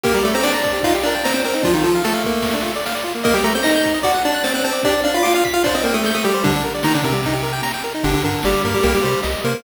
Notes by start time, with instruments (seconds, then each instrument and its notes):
0.04 lead 1 (square) A#3 G4 A#4, kick, crash
0.14 lead 1 (square) G3 G4 A#4
0.23 lead 1 (square) A3 A4 D5
0.34 lead 1 (square) C4 C5 A#5
0.43 lead 1 (square) D4 D5 D6, snare
0.54 lead 1 (square) A#5
0.64 lead 1 (square) D5, kick
0.73 lead 1 (square) G4
0.83 lead 1 (square) D#4 F4 F5, kick, ride
0.94 lead 1 (square) G4
1.03 lead 1 (square) D4 A#4 D5
1.15 lead 1 (square) G5
1.24 lead 1 (square) C4 C5 A#5, snare
1.34 lead 1 (square) C4 C5 G5
1.44 lead 1 (square) C4 A#4 C5
1.54 lead 1 (square) D#4
1.63 lead 1 (square) F3 D4 F4, kick, ride
1.74 lead 1 (square) D#3 D#4 F4
1.84 lead 1 (square) F3 F4 A4
1.95 lead 1 (square) F5
2.04 lead 1 (square) A3 A4 A5, snare
2.14 lead 1 (square) F5
2.24 lead 1 (square) A#3, kick
2.42 kick, ride
2.54 lead 1 (square) D4
2.63 lead 1 (square) F4
2.76 lead 1 (square) D5
2.86 lead 1 (square) F5, snare
2.95 lead 1 (square) D5
3.04 lead 1 (square) F4
3.15 lead 1 (square) A#3
3.24 lead 1 (square) A#3 A#4 D#5, kick, ride
3.34 lead 1 (square) G3 G4 G5
3.44 lead 1 (square) A3 A4 A#5
3.55 lead 1 (square) C4 C5 G6
3.63 lead 1 (square) D#4 D#5 A#6, snare
3.75 lead 1 (square) G6
3.84 lead 1 (square) A#5, kick
3.94 lead 1 (square) D#5
4.03 lead 1 (square) F#4 D5 F#5, kick, ride
4.14 lead 1 (square) F#5
4.25 lead 1 (square) D4 D5 A5
4.34 lead 1 (square) F#6
4.44 lead 1 (square) C4 C5 A6, snare
4.54 lead 1 (square) C4 C5 F#6
4.64 lead 1 (square) C4 C5 A5
4.73 lead 1 (square) D5
4.83 lead 1 (square) D4 G4 D5, kick, ride
4.93 lead 1 (square) D5
5.04 lead 1 (square) D4 D5 F5
5.14 lead 1 (square) F4 F5 B5
5.23 lead 1 (square) F4 F5 D6, snare
5.34 lead 1 (square) F4 F5 F6
5.45 lead 1 (square) B6, kick
5.54 lead 1 (square) F4 F5 F6
5.64 lead 1 (square) D4 C5 D5, kick, ride
5.75 lead 1 (square) C4 C5 D#5
5.84 lead 1 (square) A#3 A#4 G5
5.94 lead 1 (square) A3 A4 D#6
6.04 lead 1 (square) A3 A4 G6, snare
6.15 lead 1 (square) A3 A4 D#6
6.24 lead 1 (square) G3 G4 G5
6.34 lead 1 (square) C5
6.44 lead 1 (square) D3 G3 D4, kick, ride
6.56 lead 1 (square) D4
6.64 lead 1 (square) A#4
6.75 lead 1 (square) D5
6.83 lead 1 (square) D#3 D#4 A#5, snare
6.94 lead 1 (square) D3 D4 D5
7.03 lead 1 (square) C3 C4 A#4, kick
7.12 lead 1 (square) G3
7.23 lead 1 (square) D#4, kick, ride
7.33 lead 1 (square) G4
7.43 lead 1 (square) A#4
7.53 lead 1 (square) G5
7.63 lead 1 (square) A#5, snare
7.74 lead 1 (square) G5
7.84 lead 1 (square) A#4
7.95 lead 1 (square) D#4
8.03 synth bass 1 G1, lead 1 (square) D3 D4 G4, kick, ride
8.14 lead 1 (square) D3 D4
8.23 synth bass 1 G2, lead 1 (square) D3 D4 A#4, ride
8.43 synth bass 1 G1, lead 1 (square) G3 G4 D5, snare
8.64 synth bass 1 G2, lead 1 (square) A#3 A#4, kick, ride
8.74 lead 1 (square) G3 G4
8.83 synth bass 1 C2, lead 1 (square) A#3 G4 A#4, kick, ride
8.94 lead 1 (square) G3 G4
9.03 synth bass 1 C3, lead 1 (square) G3 G4 C5
9.23 synth bass 1 C2, lead 1 (square) D#5, snare, ride
9.44 synth bass 1 C3, lead 1 (square) A#3 A#4 C5, ride
9.54 lead 1 (square) A#3 A#4